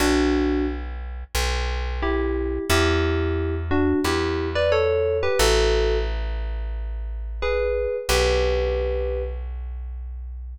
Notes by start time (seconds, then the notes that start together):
0.00 B1 D4 F#4
1.35 B1
2.02 E4 G4
2.70 E2 E4 G4
3.71 D4 F#4
4.04 E2 E4 G4
4.55 B4 D5
4.72 A4 C#5
5.23 G4 B4
5.39 A1 F#4 A4
7.42 G#4 B4
8.09 B1 G4 B4